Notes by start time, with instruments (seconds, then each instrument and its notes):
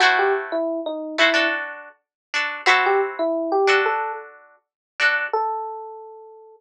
0.00 pizzicato strings A3 E4 F#4 C5, electric piano 1 F#4
0.19 electric piano 1 G4
0.52 electric piano 1 E4
0.86 electric piano 1 D#4
1.18 pizzicato strings A3 E4 F#4 C5, electric piano 1 E4
1.34 pizzicato strings D4 F#4 A4
2.34 pizzicato strings D4 F#4 A4
2.66 pizzicato strings C4 E4 F#4 A4, electric piano 1 F#4
2.86 electric piano 1 G4
3.19 electric piano 1 E4
3.52 electric piano 1 G4
3.67 pizzicato strings D4 F#4 A4
3.86 electric piano 1 A4
5.00 pizzicato strings D4 F#4 A4
5.33 electric piano 1 A4